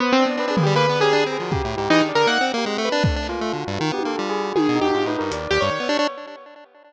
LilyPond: <<
  \new Staff \with { instrumentName = "Acoustic Grand Piano" } { \time 4/4 \tempo 4 = 158 \tuplet 3/2 { b8 c'8 b8 c'8 aes'8 g'8 b'4 aes'4 bes'4 } | r4 \tuplet 3/2 { ees'8 d'8 bes'8 } ges''8 r4 b'8 | r1 | \tuplet 3/2 { aes'4 g'4 ees'4 } r8 g'16 des''4~ des''16 | }
  \new Staff \with { instrumentName = "Tubular Bells" } { \time 4/4 c''8. d''16 b'8 aes'8 \tuplet 3/2 { b'8 d''8 g'8 } r8 aes'16 ges'16 | \tuplet 3/2 { g'8 e'8 g'8 } aes'8 d''8 r8. g'16 c'4 | \tuplet 3/2 { a4 f'4 ges'4 f'8 g'8 a'8 f'8 aes'8 ges'8 } | bes'8 ees'16 ges'16 \tuplet 3/2 { f'8 b'8 bes'8 d''4 d''4 des''4 } | }
  \new Staff \with { instrumentName = "Lead 1 (square)" } { \time 4/4 r8 d'8 d'16 d'16 bes16 g16 \tuplet 3/2 { bes8 b8 des'8 d'8 c'8 f8 } | \tuplet 3/2 { des8 a,8 aes,8 e8 ees8 d8 bes8 c'8 bes8 aes8 a8 d'8 } | \tuplet 3/2 { d'8 d'8 bes8 a8 d8 g,8 ees8 b8 bes8 } g4 | \tuplet 3/2 { ees8 b,8 e,8 aes,8 a,8 g,8 } ees,8 ees,16 g,16 ees16 b16 d'16 d'16 | }
  \new DrumStaff \with { instrumentName = "Drums" } \drummode { \time 4/4 r4 r8 tomfh8 r4 r4 | bd4 r4 r4 r4 | bd8 hc8 r4 tommh8 tommh8 r4 | tommh4 r4 hh4 r4 | }
>>